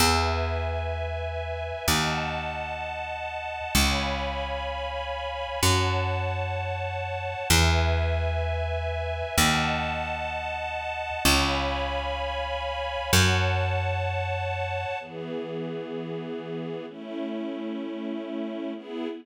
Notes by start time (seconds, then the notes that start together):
0.00 E2 B4 E5 G#5
1.88 D#2 D#5 F#5 A5
3.75 C#2 C#5 F5 G#5 B5
5.62 F#2 C#5 F#5 A5
7.50 E2 B4 E5 G#5
9.38 D#2 D#5 F#5 A5
11.25 C#2 C#5 F5 G#5 B5
13.12 F#2 C#5 F#5 A5
15.00 E3 B3 G#4
16.88 A3 C#4 E4
18.75 B3 E4 G#4